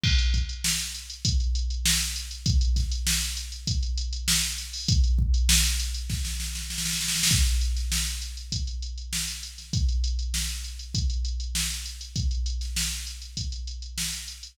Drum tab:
CC |x-------------------------------|--------------------------------|--------------------------------|--------------------------------|
HH |--x-x-x---x-x-x-x-x-x-x---x-x-x-|x-x-x-x---x-x-x-x-x-x-x---x-x-o-|x-x---x---x-x-x-----------------|x-x-x-x---x-x-x-x-x-x-x---x-x-x-|
SD |--------o---------------o-o-----|----o---o---------------o---o---|--------o-o-----o-o-o-o-oooooooo|------o-o---------------o-o---o-|
BD |o---o-----------o---------------|o---o-----------o---------------|o---o-----------o---------------|o---------------o---------------|

CC |--------------------------------|--------------------------------|
HH |x-x-x-x---x-x-x-x-x-x-x---x-x-x-|x-x-x-x---x-x-x-x-x-x-x---x-x-x-|
SD |--------o---------------o-------|------o-o---------------o-------|
BD |o---------------o---------------|o---------------o---------------|